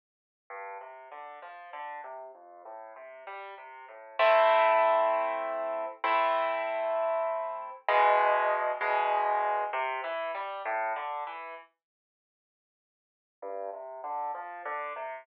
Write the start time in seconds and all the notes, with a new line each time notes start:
0.50 G2
0.81 C3
1.12 D3
1.42 F3
1.73 D3
2.04 C3
2.35 F2
2.65 A2
2.96 C3
3.27 G3
3.58 C3
3.88 A2
4.19 A3 C4 E4
6.04 A3 C4 E4
7.88 E2 B2 G#3
8.81 E2 B2 G#3
9.73 C3
10.04 E3
10.35 G3
10.65 A2
10.96 D3
11.27 E3
13.42 G2
13.73 C3
14.04 D3
14.35 F3
14.65 D3
14.96 C3